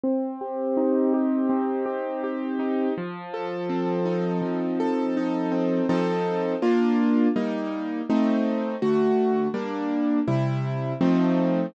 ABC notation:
X:1
M:4/4
L:1/8
Q:1/4=82
K:Bb
V:1 name="Acoustic Grand Piano"
C G E G C G G E | F, A C E F, A E C | [F,CEA]2 [B,DF]2 [G,B,E]2 [A,CE]2 | [D,A,^F]2 [G,B,D]2 [C,G,=E]2 [=F,A,C_E]2 |]